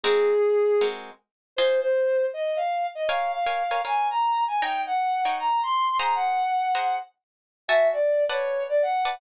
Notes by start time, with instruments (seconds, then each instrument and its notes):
0.04 acoustic guitar (steel) G#3 C4 F#4 A#4, brass section G#4
0.81 acoustic guitar (steel) G#3 C4 F#4 A#4
1.56 acoustic guitar (steel) F4 C5 D#5 G#5, brass section C5
1.81 brass section C5
2.33 brass section D#5
2.56 brass section F5
2.95 brass section D#5
3.09 acoustic guitar (steel) A#4 C#5 F5 G#5, brass section F5
3.33 brass section F5
3.46 acoustic guitar (steel) A#4 C#5 F5 G#5
3.71 acoustic guitar (steel) A#4 C#5 F5 G#5
3.85 acoustic guitar (steel) A#4 C#5 F5 G#5, brass section G#5
4.10 brass section A#5
4.47 brass section G#5
4.62 acoustic guitar (steel) D#4 C#5 G5 A#5, brass section G5
4.86 brass section F#5
5.25 acoustic guitar (steel) D#4 C#5 G5 A#5
5.39 brass section A#5
5.63 brass section C6
5.99 acoustic guitar (steel) G#4 C5 F#5 A#5, brass section A#5
6.15 brass section F#5
6.75 acoustic guitar (steel) G#4 C5 F#5 A#5
7.68 acoustic guitar (steel) F#4 E5 G#5 A5, brass section E5
7.93 brass section D5
8.29 acoustic guitar (steel) B4 D5 F#5 A5, brass section C#5
8.69 brass section D5
8.82 brass section F#5
9.05 acoustic guitar (steel) B4 D5 F#5 A5